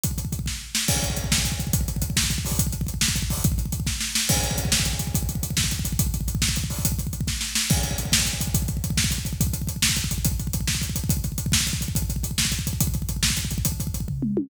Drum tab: CC |------------|x-----------|------------|------------|
HH |x-x-x-------|--x-x---x-x-|x-x-x---x-o-|x-x-x---x-o-|
SD |------o---o-|------o-----|------o-----|------o-----|
T1 |------------|------------|------------|------------|
T2 |------------|------------|------------|------------|
FT |------------|------------|------------|------------|
BD |ooooooo-----|oooooooooooo|oooooooooooo|oooooooooooo|

CC |------------|x-----------|------------|------------|
HH |x-x-x-------|--x-x---x-x-|x-x-x---x-x-|x-x-x---x-o-|
SD |------o-o-o-|------o-----|------o-----|------o-----|
T1 |------------|------------|------------|------------|
T2 |------------|------------|------------|------------|
FT |------------|------------|------------|------------|
BD |ooooooo-----|oooooooooooo|oooooooooooo|oooooooooooo|

CC |------------|x-----------|------------|------------|
HH |x-x-x-------|--x-x---x-x-|x-x-x---x-x-|x-x-x---x-x-|
SD |------o-o-o-|------o-----|------o-----|------o-----|
T1 |------------|------------|------------|------------|
T2 |------------|------------|------------|------------|
FT |------------|------------|------------|------------|
BD |ooooooo-----|oooooooooooo|oooooooooooo|oooooooooooo|

CC |------------|------------|------------|------------|
HH |x-x-x---x-x-|x-x-x---x-x-|x-x-x---x-x-|x-x-x---x-x-|
SD |------o-----|------o-----|------o-----|------o-----|
T1 |------------|------------|------------|------------|
T2 |------------|------------|------------|------------|
FT |------------|------------|------------|------------|
BD |oooooooooooo|oooooooooooo|oooooooooooo|oooooooooooo|

CC |------------|
HH |x-x-x-------|
SD |------------|
T1 |----------o-|
T2 |--------o---|
FT |------o-----|
BD |ooooooo-----|